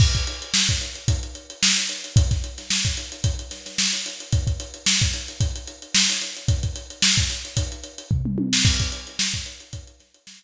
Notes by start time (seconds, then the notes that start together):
0.00 kick, crash
0.15 kick, closed hi-hat
0.27 closed hi-hat
0.42 closed hi-hat
0.54 snare
0.69 kick, closed hi-hat
0.81 closed hi-hat
0.95 closed hi-hat
1.08 kick, closed hi-hat
1.23 closed hi-hat
1.35 closed hi-hat
1.50 closed hi-hat
1.63 snare
1.77 closed hi-hat
1.89 closed hi-hat
2.04 closed hi-hat
2.16 kick, closed hi-hat
2.31 kick, snare, closed hi-hat
2.44 closed hi-hat
2.58 snare, closed hi-hat
2.70 snare
2.85 kick, closed hi-hat
2.97 closed hi-hat
3.12 closed hi-hat
3.24 kick, closed hi-hat
3.39 closed hi-hat
3.51 snare, closed hi-hat
3.66 snare, closed hi-hat
3.78 snare
3.93 closed hi-hat
4.06 closed hi-hat
4.20 closed hi-hat
4.32 kick, closed hi-hat
4.47 kick, closed hi-hat
4.60 closed hi-hat
4.74 closed hi-hat
4.86 snare
5.01 kick, snare, closed hi-hat
5.14 closed hi-hat
5.28 closed hi-hat
5.40 kick, closed hi-hat
5.56 closed hi-hat
5.67 closed hi-hat
5.82 closed hi-hat
5.95 snare
6.09 closed hi-hat
6.21 closed hi-hat
6.36 closed hi-hat
6.48 kick, closed hi-hat
6.63 kick, closed hi-hat
6.76 closed hi-hat
6.90 closed hi-hat
7.02 snare
7.17 kick, closed hi-hat
7.30 closed hi-hat
7.45 closed hi-hat
7.57 kick, closed hi-hat
7.72 closed hi-hat
7.83 closed hi-hat
7.98 closed hi-hat
8.11 kick, floor tom
8.25 mid tom
8.38 high tom
8.53 snare
8.65 kick, crash
8.80 kick, closed hi-hat
8.92 closed hi-hat
9.07 closed hi-hat
9.19 snare
9.34 kick, closed hi-hat
9.46 closed hi-hat
9.60 closed hi-hat
9.73 kick, closed hi-hat
9.87 closed hi-hat
10.00 snare, closed hi-hat
10.14 closed hi-hat
10.27 snare
10.42 closed hi-hat